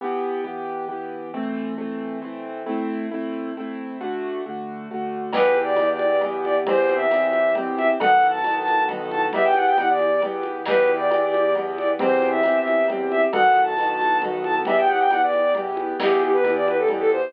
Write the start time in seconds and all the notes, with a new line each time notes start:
0.01 E3 B3 G4
0.44 E3 B3 G4
0.88 E3 B3 G4
1.33 E3 A3 C4
1.78 E3 A3 C4
2.22 E3 A3 C4
2.66 A3 C4 E4
3.11 A3 C4 E4
3.57 A3 C4 E4
4.00 D3 A3 F#4
4.46 D3 A3 F#4
4.90 D3 A3 F#4
5.33 E2 E3 B3 G4 B4, crash, cowbell, low conga
5.55 high conga
5.63 D5
5.76 E2 E3 B3 G4, tambourine, cowbell, high conga
5.93 D5
5.99 high conga
6.21 E3 B3 G4, cowbell, low conga
6.44 D5, high conga
6.67 E2 E3 C4 G4 C5, cowbell, low conga
6.89 high conga
6.96 E5
7.10 E2 E3 C4 G4, tambourine, cowbell, high conga
7.26 E5
7.33 high conga
7.55 E3 C4 G4, cowbell, low conga
7.77 E5, high conga
8.00 B1 D#3 B3 F#4 A4 F#5, cowbell, low conga
8.23 high conga
8.29 A5
8.44 B1 D#3 B3 F#4 A4, tambourine, cowbell, high conga
8.59 A5
8.68 high conga
8.88 D#3 B3 F#4 A4, cowbell, low conga
9.11 A5, high conga
9.33 E2 E3 B3 G4 E5, cowbell, low conga
9.44 G5
9.54 F#5, high conga
9.67 G5
9.77 E2 E3 B3 G4 F#5, tambourine, cowbell, high conga
9.89 D5
9.99 high conga
10.22 E3 B3 G4, cowbell, low conga
10.43 high conga
10.66 E2 E3 B3 G4 B4, crash, cowbell, low conga
10.87 high conga
10.96 D5
11.10 E2 E3 B3 G4, tambourine, cowbell, high conga
11.26 D5
11.34 high conga
11.55 E3 B3 G4, cowbell, low conga
11.78 D5, high conga
11.99 E2 E3 C4 G4 C5, cowbell, low conga
12.22 high conga
12.30 E5
12.43 E2 E3 C4 G4, tambourine, cowbell, high conga
12.59 E5
12.68 high conga
12.88 E3 C4 G4, cowbell, low conga
13.11 E5, high conga
13.33 B1 D#3 B3 F#4 A4 F#5, cowbell, low conga
13.56 high conga
13.63 A5
13.77 B1 D#3 B3 F#4 A4, tambourine, cowbell, high conga
13.93 A5
14.01 high conga
14.22 D#3 B3 F#4 A4, cowbell, low conga
14.44 A5, high conga
14.65 E2 E3 B3 G4 E5, cowbell, low conga
14.78 G5
14.88 F#5, high conga
15.00 G5
15.10 E2 E3 B3 G4 F#5, tambourine, cowbell, high conga
15.22 D5
15.33 high conga
15.55 E3 B3 G4, cowbell, low conga
15.77 high conga
16.00 E2 E3 B3 G4, crash, cowbell, low conga
16.21 G4, high conga
16.33 B4
16.44 E2 E3 B3 G4, tambourine, cowbell, high conga
16.55 D5
16.66 B4, high conga
16.78 A4
16.88 E3 B3 G4, cowbell, low conga
17.00 A4
17.12 C5, high conga